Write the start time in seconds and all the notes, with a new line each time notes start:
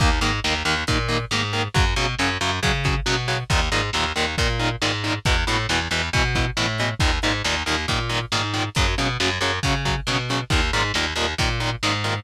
0.00 D#2 D#3 A#3, kick, closed hi-hat
0.21 G#2 D#3 A#3, closed hi-hat
0.44 D#2 D#3 A#3, snare
0.65 D#2 D#3 A#3, closed hi-hat
0.87 A#2 D#3 A#3, kick, closed hi-hat
1.08 D#3 A#3, closed hi-hat
1.31 G#2 D#3 A#3, snare
1.53 D#3 A#3, closed hi-hat
1.74 F#2 C#3 F#3, kick, closed hi-hat
1.96 B2 C#3 F#3, closed hi-hat
2.19 F#2 C#3 F#3, snare
2.41 F#2 C#3 F#3, closed hi-hat
2.63 C#3 F#3, kick, closed hi-hat
2.84 C#3 F#3, kick, closed hi-hat
3.06 B2 C#3 F#3, snare
3.28 C#3 F#3, closed hi-hat
3.50 D#2 A#2 D#3, kick, closed hi-hat
3.72 G#2 A#2 D#3, closed hi-hat
3.93 D#2 A#2 D#3, snare
4.16 D#2 A#2 D#3, closed hi-hat
4.38 A#2 D#3, kick, closed hi-hat
4.59 A#2 D#3, closed hi-hat
4.82 G#2 A#2 D#3, snare
5.04 A#2 D#3, closed hi-hat
5.25 E2 B2 E3, kick, closed hi-hat
5.47 A2 B2 E3, closed hi-hat
5.69 E2 B2 E3, snare
5.91 E2 B2 E3, closed hi-hat
6.13 B2 E3, kick, closed hi-hat
6.35 B2 E3, kick, closed hi-hat
6.57 A2 B2 E3, snare
6.78 B2 E3, closed hi-hat
7.00 D#2 A#2 D#3, kick, closed hi-hat
7.22 G#2 A#2 D#3, closed hi-hat
7.44 D#2 A#2 D#3, snare
7.66 D#2 A#2 D#3, closed hi-hat
7.88 A#2 D#3, kick, closed hi-hat
8.09 A#2 D#3, closed hi-hat
8.32 G#2 A#2 D#3, snare
8.53 A#2 D#3, closed hi-hat
8.75 F#2 C#3 F#3, kick, closed hi-hat
8.98 B2 C#3 F#3, closed hi-hat
9.20 F#2 C#3 F#3, snare
9.41 F#2 C#3 F#3, closed hi-hat
9.63 C#3 F#3, kick, closed hi-hat
9.85 C#3 F#3, kick, closed hi-hat
10.07 B2 C#3 F#3, snare
10.29 C#3 F#3, closed hi-hat
10.50 D#2 A#2 D#3, kick, closed hi-hat
10.73 G#2 A#2 D#3, closed hi-hat
10.94 D#2 A#2 D#3, snare
11.16 D#2 A#2 D#3, closed hi-hat
11.38 A#2 D#3, kick, closed hi-hat
11.60 A#2 D#3, closed hi-hat
11.83 G#2 A#2 D#3, snare
12.04 A#2 D#3, closed hi-hat